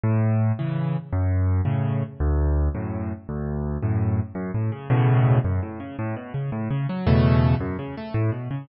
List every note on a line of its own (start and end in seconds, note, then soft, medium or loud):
0.04 0.52 A2 medium
0.59 0.97 C#3 medium
0.59 0.97 E3 medium
1.13 1.61 F#2 medium
1.65 2.03 A2 medium
1.65 2.03 C#3 medium
2.20 2.69 D2 medium
2.75 3.12 F#2 medium
2.75 3.12 A2 medium
3.29 3.78 D2 medium
3.83 4.20 F#2 medium
3.83 4.20 A2 medium
4.35 4.51 F#2 medium
4.54 4.71 A2 medium
4.72 4.88 C#3 medium
4.90 5.39 E2 medium
4.90 5.39 A2 medium
4.90 5.39 B2 medium
4.90 5.39 C#3 medium
5.45 5.61 F#2 medium
5.63 5.79 A2 medium
5.80 5.96 C#3 medium
5.99 6.15 A2 medium
6.16 6.33 B2 medium
6.34 6.50 C#3 medium
6.52 6.68 A2 medium
6.70 6.87 C#3 medium
6.89 7.06 F#3 medium
7.07 7.55 E2 medium
7.07 7.55 B2 medium
7.07 7.55 C#3 medium
7.07 7.55 A3 medium
7.60 7.77 F#2 medium
7.79 7.95 C#3 medium
7.97 8.14 A3 medium
8.14 8.31 A2 medium
8.32 8.48 B2 medium
8.51 8.67 C#3 medium